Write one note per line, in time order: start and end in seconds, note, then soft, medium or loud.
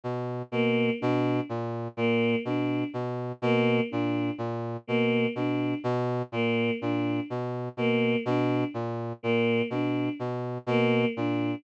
0.04 0.42 B2 medium
0.52 0.90 B2 medium
0.52 0.91 A#3 medium
1.00 1.41 B2 medium
1.00 1.39 D4 medium
1.49 1.88 A#2 medium
1.97 2.35 A#2 medium
1.97 2.36 A#3 medium
2.45 2.84 B2 medium
2.45 2.84 D4 medium
2.94 3.32 B2 medium
3.42 3.80 B2 medium
3.42 3.81 A#3 medium
3.91 4.31 A#2 medium
3.91 4.29 D4 medium
4.38 4.77 A#2 medium
4.87 5.27 B2 medium
4.87 5.26 A#3 medium
5.35 5.74 B2 medium
5.35 5.74 D4 medium
5.84 6.22 B2 medium
6.32 6.71 A#2 medium
6.32 6.71 A#3 medium
6.81 7.20 A#2 medium
6.81 7.20 D4 medium
7.30 7.69 B2 medium
7.77 8.16 B2 medium
7.77 8.16 A#3 medium
8.25 8.64 B2 medium
8.25 8.65 D4 medium
8.74 9.13 A#2 medium
9.23 9.62 A#2 medium
9.23 9.61 A#3 medium
9.70 10.09 B2 medium
9.70 10.10 D4 medium
10.19 10.58 B2 medium
10.66 11.05 B2 medium
10.66 11.07 A#3 medium
11.16 11.55 A#2 medium
11.16 11.55 D4 medium